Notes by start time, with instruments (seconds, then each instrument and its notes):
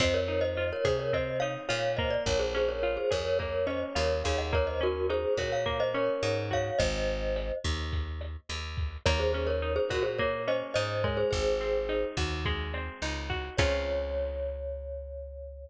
0.00 electric bass (finger) F2, acoustic guitar (steel) C4, glockenspiel C5 D#5, kick, cross-stick, closed hi-hat
0.14 glockenspiel A#4 C#5
0.28 acoustic guitar (steel) D#4, glockenspiel A#4 C#5, closed hi-hat
0.41 glockenspiel C5 D#5
0.57 acoustic guitar (steel) F4, closed hi-hat
0.73 glockenspiel A#4 C#5
0.85 electric bass (finger) C3, glockenspiel G#4 C5, acoustic guitar (steel) G#4, kick, cross-stick, closed hi-hat
0.99 glockenspiel A#4 C#5
1.13 acoustic guitar (steel) C4, glockenspiel C5 D#5, kick, closed hi-hat
1.40 acoustic guitar (steel) D#4, glockenspiel C#5 F5, closed hi-hat
1.69 electric bass (finger) A#2, acoustic guitar (steel) F4, glockenspiel C#5 F5, cross-stick, closed hi-hat
1.97 acoustic guitar (steel) A#3, glockenspiel C5 D#5, kick, closed hi-hat
2.10 glockenspiel D5
2.26 electric bass (finger) A#1, glockenspiel A#4 C#5, kick, closed hi-hat
2.39 glockenspiel G#4 C5
2.55 acoustic guitar (steel) C#4, glockenspiel G#4 C5, closed hi-hat
2.69 glockenspiel A#4 C#5
2.83 acoustic guitar (steel) F4, cross-stick, closed hi-hat
2.97 glockenspiel G#4 C5
3.11 electric bass (finger) F2, acoustic guitar (steel) G#4, glockenspiel A#4 C#5, kick, closed hi-hat
3.25 glockenspiel A#4 C#5
3.39 acoustic guitar (steel) A#3, glockenspiel A#4 C#5, kick, closed hi-hat
3.67 acoustic guitar (steel) C#4, glockenspiel C5 D#5, cross-stick, closed hi-hat
3.95 electric bass (finger) D#2, acoustic guitar (steel) F4, glockenspiel A#4 C#5, closed hi-hat
4.24 electric bass (finger) D#2, acoustic guitar (steel) G#4, glockenspiel C#5 F5, kick, closed hi-hat
4.38 glockenspiel D#5 F#5
4.53 acoustic guitar (steel) A#3, glockenspiel A#4 C#5, kick, cross-stick, closed hi-hat
4.67 glockenspiel C5 D#5
4.81 acoustic guitar (steel) C#4, glockenspiel F#4 A#4, closed hi-hat
5.09 acoustic guitar (steel) D#4, glockenspiel G#4 C5, closed hi-hat
5.37 electric bass (finger) A#2, acoustic guitar (steel) F#4, glockenspiel A#4 C#5, kick, cross-stick, closed hi-hat
5.52 glockenspiel C#5 F5
5.66 acoustic guitar (steel) A#3, kick, closed hi-hat
5.80 glockenspiel C5 D#5
5.94 acoustic guitar (steel) C#4, glockenspiel A#4 C#5, closed hi-hat
6.23 electric bass (finger) G#2, acoustic guitar (steel) D#4, cross-stick, closed hi-hat
6.51 acoustic guitar (steel) F#4, glockenspiel C#5 F5, kick, closed hi-hat
6.79 electric bass (finger) G#1, glockenspiel C5 D#5, kick, closed hi-hat
7.08 closed hi-hat
7.36 cross-stick, closed hi-hat
7.64 electric bass (finger) D#2, kick, closed hi-hat
7.92 kick, closed hi-hat
8.21 cross-stick, closed hi-hat
8.49 electric bass (finger) D#2, closed hi-hat
8.77 kick, closed hi-hat
9.06 electric bass (finger) D#2, acoustic guitar (steel) A#3, glockenspiel A#4 C#5, kick, cross-stick, closed hi-hat
9.19 glockenspiel G#4 C5
9.33 acoustic guitar (steel) C#4, glockenspiel G#4 C5, closed hi-hat
9.47 glockenspiel A#4 C#5
9.62 acoustic guitar (steel) D#4, closed hi-hat
9.76 glockenspiel G#4 C5
9.89 electric bass (finger) A#2, glockenspiel F#4 A#4, acoustic guitar (steel) F#4, kick, cross-stick, closed hi-hat
10.03 glockenspiel G#4 C5
10.19 acoustic guitar (steel) A#3, glockenspiel A#4 C#5, kick, closed hi-hat
10.47 acoustic guitar (steel) C#4, glockenspiel C5 D#5, closed hi-hat
10.74 electric bass (finger) G#2, acoustic guitar (steel) D#4, glockenspiel C5 D#5, cross-stick, closed hi-hat
11.04 acoustic guitar (steel) G#3, glockenspiel A#4 C#5, kick, closed hi-hat
11.17 glockenspiel G#4 C5
11.31 electric bass (finger) G#1, glockenspiel G#4 C5, kick, closed hi-hat
11.60 acoustic guitar (steel) C4, closed hi-hat
11.89 acoustic guitar (steel) D#4, cross-stick, closed hi-hat
12.17 electric bass (finger) D#2, acoustic guitar (steel) F#4, kick, closed hi-hat
12.45 acoustic guitar (steel) G#3, kick, closed hi-hat
12.74 acoustic guitar (steel) C4, cross-stick, closed hi-hat
13.02 electric bass (finger) C#2, acoustic guitar (steel) D#4, closed hi-hat
13.30 acoustic guitar (steel) F#4, kick, closed hi-hat
13.57 electric bass (finger) C#2, acoustic guitar (steel) C4 C#4 F4 G#4, glockenspiel C#5, kick, crash